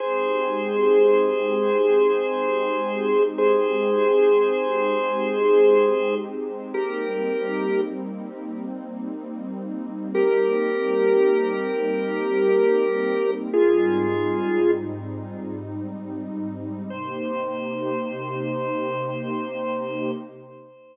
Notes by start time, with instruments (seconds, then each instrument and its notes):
0.00 pad 2 (warm) G#3 C4 D#4 G4, drawbar organ G#4 C5
3.38 drawbar organ G#4 C5
6.74 pad 2 (warm) G3 A#3 C4 D#4, drawbar organ G4 A#4
10.14 drawbar organ G4 A#4
13.52 pad 2 (warm) G#2 G3 C4 D#4, drawbar organ F4 G#4
16.90 pad 2 (warm) C3 A#3 D#4 G4, drawbar organ C5